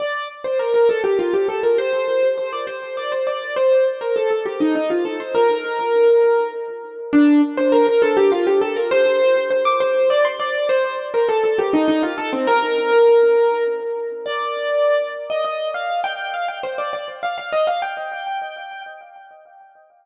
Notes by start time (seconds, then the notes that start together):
0.00 D5
0.44 C5
0.59 A#4
0.74 A#4
0.89 A4
1.04 G4
1.19 F4
1.34 G4
1.49 A4
1.63 A#4
1.78 C5
2.38 C5
2.53 D5
2.67 C5
2.97 D5
3.12 C5
3.27 D5
3.56 C5
4.01 A#4
4.16 A4
4.31 A4
4.46 G4
4.60 D#4
4.75 D#4
4.90 F4
5.05 A4
5.20 C5
5.35 A#4
7.13 D4
7.57 C5
7.72 A#4
7.87 A#4
8.02 A4
8.17 G4
8.32 F4
8.47 G4
8.61 A4
8.76 A#4
8.91 C5
9.50 C5
9.65 D6
9.80 C5
10.10 D5
10.25 C6
10.40 D5
10.69 C5
11.14 A#4
11.29 A4
11.44 A4
11.59 G4
11.73 D#4
11.88 D#4
12.03 F4
12.18 A4
12.33 C4
12.47 A#4
14.26 D5
15.30 D#5
15.45 D#5
15.74 F5
16.04 G5
16.34 F5
16.48 G5
16.63 C5
16.78 D5
16.93 D5
17.23 F5
17.38 F5
17.52 D#5
17.67 F5
17.82 G5